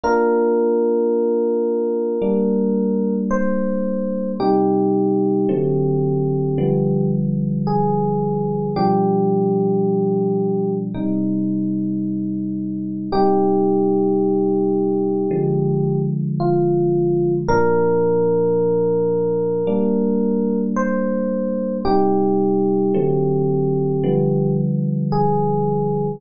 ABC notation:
X:1
M:4/4
L:1/8
Q:1/4=55
K:Cm
V:1 name="Electric Piano 1"
B6 c2 | G6 A2 | G4 z4 | G6 F2 |
B6 c2 | G6 A2 |]
V:2 name="Electric Piano 1"
[B,DF]4 [G,B,D]4 | [C,G,E]2 [D,^F,=A,C]2 [D,=F,G,=B,]4 | [=B,,F,G,D]4 [C,G,E]4 | [C,G,E]4 [D,F,A,]4 |
[B,,F,D]4 [G,B,D]4 | [C,G,E]2 [D,^F,=A,C]2 [D,=F,G,=B,]4 |]